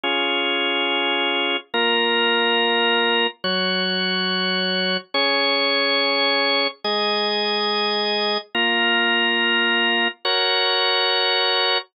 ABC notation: X:1
M:4/4
L:1/8
Q:1/4=141
K:Db
V:1 name="Drawbar Organ"
[DFA]8 | [B,FB]8 | [G,Gd]8 | [DAd]8 |
[A,Ae]8 | [B,FB]8 | [GBd]8 |]